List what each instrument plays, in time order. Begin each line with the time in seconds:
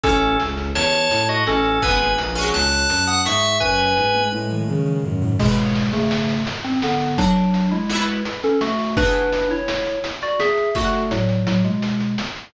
0.03 violin A1, drawbar organ C#4 A4, harpsichord C#4 E4, kick, closed hi-hat
0.09 harpsichord A3
0.22 closed hi-hat
0.40 violin C#2, closed hi-hat
0.57 closed hi-hat
0.75 violin E2, drawbar organ C#5 A5, snare
0.93 closed hi-hat
1.11 violin A2, closed hi-hat
1.29 drawbar organ F#4 D#5, closed hi-hat
1.47 violin A1, drawbar organ C#4 A4, snare
1.65 closed hi-hat
1.82 violin G#1, harpsichord B3 D#4, drawbar organ B4 G#5, kick, closed hi-hat
1.88 harpsichord G#3 A#3
2.00 closed hi-hat
2.18 violin A#1, closed hi-hat
2.35 harpsichord G#3 C#4, closed hi-hat
2.41 harpsichord F#3
2.54 violin C#2, drawbar organ A5 F#6, snare
2.72 closed hi-hat
2.89 violin F#2, closed hi-hat
3.07 drawbar organ F#5 D#6, closed hi-hat
3.25 violin G#2, drawbar organ E5 C#6, snare
3.43 closed hi-hat
3.60 violin F#2, drawbar organ B4 G#5, kick, snare
3.79 snare
3.97 violin G#2, snare
4.14 high tom
4.32 violin A2, high tom
4.50 mid tom
4.68 violin C#3, mid tom
4.86 mid tom
5.04 violin F#2, floor tom
5.22 floor tom
5.39 electric piano 2 B2 G#3, harpsichord E4 G#4, kick, crash
5.45 harpsichord C#3 B3
5.57 closed hi-hat
5.75 closed hi-hat
5.93 electric piano 2 C#3 A3, closed hi-hat
6.11 snare
6.29 closed hi-hat
6.47 closed hi-hat
6.64 electric piano 2 C4, closed hi-hat
6.82 electric piano 2 D3 B3, snare
7.00 closed hi-hat
7.18 electric piano 2 F#3 D4, harpsichord F#4 A4, kick, closed hi-hat
7.24 harpsichord D4
7.36 closed hi-hat
7.54 closed hi-hat
7.71 electric piano 2 G#3 E4, closed hi-hat
7.90 harpsichord E4 F#4, snare
7.95 harpsichord B3
8.07 closed hi-hat
8.25 closed hi-hat
8.43 electric piano 2 C#4 A4, closed hi-hat
8.61 electric piano 2 A3 F#4, snare
8.79 open hi-hat
8.97 electric piano 2 D4 B4, harpsichord F#4 G#4, kick, closed hi-hat
9.02 harpsichord E3 B3
9.14 closed hi-hat
9.32 closed hi-hat
9.50 electric piano 2 E4 C#5, closed hi-hat
9.68 snare
9.86 closed hi-hat
10.04 closed hi-hat
10.22 electric piano 2 F#4 D5, closed hi-hat
10.40 electric piano 2 G#4 E5, snare
10.57 closed hi-hat
10.75 electric piano 2 A3 F#4, harpsichord F#4 A4, kick, closed hi-hat
10.80 harpsichord D4
10.93 closed hi-hat
11.11 electric piano 2 A2 F#3, closed hi-hat
11.29 closed hi-hat
11.46 electric piano 2 A2 F#3, snare
11.64 electric piano 2 B2 G#3, closed hi-hat
11.82 closed hi-hat
12.00 closed hi-hat
12.18 snare
12.36 closed hi-hat